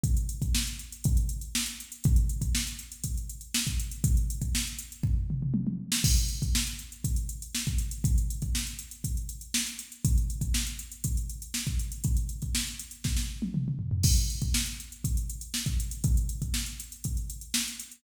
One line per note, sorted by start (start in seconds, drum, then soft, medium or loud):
0.03 kick medium
0.03 closed hi-hat medium
0.17 closed hi-hat medium
0.29 closed hi-hat medium
0.42 kick medium
0.42 closed hi-hat medium
0.54 snare loud
0.67 closed hi-hat medium
0.79 closed hi-hat medium
0.92 closed hi-hat medium
1.04 kick medium
1.04 closed hi-hat medium
1.17 closed hi-hat medium
1.29 closed hi-hat medium
1.41 closed hi-hat medium
1.55 snare loud
1.66 closed hi-hat medium
1.80 closed hi-hat medium
1.92 closed hi-hat medium
2.04 kick loud
2.04 closed hi-hat medium
2.16 closed hi-hat medium
2.29 closed hi-hat medium
2.41 kick medium
2.41 closed hi-hat medium
2.55 snare medium
2.67 closed hi-hat medium
2.79 closed hi-hat medium
2.92 closed hi-hat medium
3.04 kick medium
3.04 closed hi-hat medium
3.17 closed hi-hat medium
3.29 closed hi-hat medium
3.41 closed hi-hat medium
3.54 snare loud
3.67 kick medium
3.67 closed hi-hat medium
3.79 closed hi-hat medium
3.91 closed hi-hat medium
4.04 kick medium
4.04 closed hi-hat medium
4.17 closed hi-hat medium
4.30 closed hi-hat medium
4.42 kick medium
4.42 closed hi-hat medium
4.55 snare medium
4.67 closed hi-hat medium
4.79 closed hi-hat medium
4.92 closed hi-hat medium
5.03 kick medium
5.03 floor tom medium
5.30 mid tom medium
5.42 mid tom medium
5.54 high tom medium
5.67 high tom medium
5.92 snare loud
6.04 kick medium
6.04 crash loud
6.17 closed hi-hat medium
6.28 closed hi-hat medium
6.42 kick medium
6.42 closed hi-hat medium
6.55 snare loud
6.67 closed hi-hat medium
6.79 closed hi-hat medium
6.92 closed hi-hat medium
7.04 kick medium
7.04 closed hi-hat medium
7.16 closed hi-hat medium
7.29 closed hi-hat medium
7.42 closed hi-hat medium
7.55 snare medium
7.67 kick medium
7.67 closed hi-hat medium
7.78 closed hi-hat medium
7.91 closed hi-hat medium
8.04 kick medium
8.04 closed hi-hat medium
8.18 closed hi-hat medium
8.30 closed hi-hat medium
8.42 kick medium
8.42 closed hi-hat medium
8.55 snare medium
8.67 closed hi-hat medium
8.79 closed hi-hat medium
8.91 closed hi-hat medium
9.04 kick medium
9.04 closed hi-hat medium
9.17 closed hi-hat medium
9.29 closed hi-hat medium
9.41 closed hi-hat medium
9.54 snare loud
9.67 closed hi-hat medium
9.79 closed hi-hat medium
9.92 closed hi-hat medium
10.05 kick medium
10.05 closed hi-hat loud
10.18 closed hi-hat medium
10.30 closed hi-hat medium
10.41 kick medium
10.41 closed hi-hat medium
10.54 snare medium
10.67 closed hi-hat medium
10.79 closed hi-hat medium
10.92 closed hi-hat medium
11.04 kick medium
11.04 closed hi-hat medium
11.17 closed hi-hat medium
11.29 closed hi-hat medium
11.42 closed hi-hat medium
11.54 snare medium
11.67 kick medium
11.67 closed hi-hat medium
11.79 closed hi-hat medium
11.92 closed hi-hat medium
12.04 kick medium
12.04 closed hi-hat medium
12.17 closed hi-hat medium
12.29 closed hi-hat medium
12.42 kick medium
12.42 closed hi-hat medium
12.55 snare medium
12.67 closed hi-hat medium
12.79 closed hi-hat medium
12.91 closed hi-hat medium
13.04 kick medium
13.04 snare medium
13.17 snare medium
13.42 high tom medium
13.54 mid tom medium
13.68 mid tom medium
13.79 floor tom medium
13.91 floor tom medium
14.03 kick medium
14.03 crash loud
14.17 closed hi-hat medium
14.30 closed hi-hat medium
14.41 kick medium
14.41 closed hi-hat medium
14.54 snare loud
14.66 closed hi-hat medium
14.80 closed hi-hat medium
14.92 closed hi-hat medium
15.04 kick medium
15.04 closed hi-hat medium
15.17 closed hi-hat medium
15.30 closed hi-hat medium
15.41 closed hi-hat medium
15.54 snare medium
15.66 kick medium
15.66 closed hi-hat medium
15.80 closed hi-hat medium
15.91 closed hi-hat medium
16.04 kick medium
16.04 closed hi-hat medium
16.17 closed hi-hat medium
16.29 closed hi-hat medium
16.42 kick medium
16.42 closed hi-hat medium
16.54 snare medium
16.66 closed hi-hat medium
16.80 closed hi-hat medium
16.92 closed hi-hat medium
17.04 kick medium
17.04 closed hi-hat medium
17.17 closed hi-hat medium
17.30 closed hi-hat medium
17.41 closed hi-hat medium
17.54 snare loud
17.68 closed hi-hat medium
17.80 closed hi-hat medium
17.91 closed hi-hat medium